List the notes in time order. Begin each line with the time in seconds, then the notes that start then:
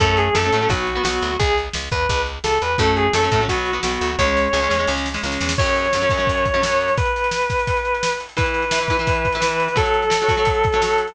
0.00 F#2 F#3 A3 C#4 A4, kick, closed hi-hat
0.17 G#4, closed hi-hat
0.35 F#2 F#3 A3 C#4 A4, snare
0.44 F#3 A3 C#4
0.52 A2 F#3 A3 C#4, closed hi-hat
0.61 F#3 A3 C#4
0.69 B1 F#3 B3 F#4, kick, closed hi-hat
0.87 closed hi-hat
0.95 F#3 B3
1.03 B1 F#3 B3 F#4, snare
1.21 D2, closed hi-hat
1.39 C#2 G#4, kick, closed hi-hat
1.58 closed hi-hat
1.73 C#2, snare
1.91 E2 B4, kick, closed hi-hat
2.09 C#2, kick, closed hi-hat
2.26 closed hi-hat
2.44 C#2 A4, snare
2.62 E2 B4, closed hi-hat
2.78 F#2 F#3 A3 C#4 A4, kick, closed hi-hat
2.96 G#4, closed hi-hat
3.13 F#2 F#3 A3 C#4 A4, snare
3.23 F#3 A3 C#4
3.32 A2 F#3 A3 C#4, kick, closed hi-hat
3.40 F#3 A3 C#4
3.48 B1 F#3 B3 F#4, kick, closed hi-hat
3.65 closed hi-hat
3.73 F#3 B3
3.83 B1 F#3 B3 F#4, snare
4.01 D2, closed hi-hat
4.18 C#2 G#3 C#4 C#5, kick, snare
4.37 snare
4.53 C#2 G#3 C#4, snare
4.62 G#3 C#4
4.69 E2 G#3 C#4, snare
4.79 G#3 C#4
4.87 C#2 G#3 C#4, snare
4.97 snare
5.06 snare
5.14 G#3 C#4, snare
5.23 C#2 G#3 C#4, snare
5.32 snare
5.41 E2, snare
5.49 snare
5.58 F#2 F#3 C#4 C#5, kick, crash
5.66 closed hi-hat
5.76 closed hi-hat
5.85 closed hi-hat
5.93 F#2 F#3 C#4, snare
6.01 F#2 F#3 C#4, closed hi-hat
6.10 F#2 F#3 C#4, kick, snare, closed hi-hat
6.17 F#2 F#3 C#4, closed hi-hat
6.27 kick, closed hi-hat
6.37 closed hi-hat
6.45 kick, closed hi-hat
6.54 F#2 F#3 C#4, closed hi-hat
6.62 F#2 F#3 C#4, snare
6.71 closed hi-hat
6.80 closed hi-hat
6.88 closed hi-hat
6.97 B4, kick, closed hi-hat
7.05 closed hi-hat
7.16 closed hi-hat
7.24 closed hi-hat
7.31 snare
7.41 closed hi-hat
7.50 kick, snare, closed hi-hat
7.59 closed hi-hat
7.67 kick, closed hi-hat
7.77 closed hi-hat
7.85 closed hi-hat
7.94 closed hi-hat
8.03 snare
8.12 closed hi-hat
8.20 closed hi-hat
8.29 closed hi-hat
8.37 E3 E4 B4, kick, closed hi-hat
8.46 closed hi-hat
8.54 closed hi-hat
8.62 closed hi-hat
8.71 E3 E4 B4, snare
8.80 E3 E4 B4, closed hi-hat
8.88 E3 E4 B4, kick, snare, closed hi-hat
8.99 E3 E4 B4, closed hi-hat
9.07 kick, closed hi-hat
9.15 closed hi-hat
9.25 kick, closed hi-hat
9.32 E3 E4, closed hi-hat
9.37 E3 B4
9.41 E4 B4, snare
9.51 closed hi-hat
9.60 closed hi-hat
9.68 closed hi-hat
9.76 F#3 F#4 A4 C#5, kick, closed hi-hat
9.86 closed hi-hat
9.94 closed hi-hat
10.02 closed hi-hat
10.10 F#3 F#4 C#5, snare
10.21 F#3 F#4 C#5, closed hi-hat
10.28 F#3 F#4 C#5, kick, snare, closed hi-hat
10.37 F#3 F#4 C#5, closed hi-hat
10.45 kick, closed hi-hat
10.55 closed hi-hat
10.64 kick, closed hi-hat
10.72 F#3 F#4 C#5, closed hi-hat
10.82 F#3 F#4 C#5, snare
10.90 closed hi-hat
10.98 closed hi-hat
11.07 closed hi-hat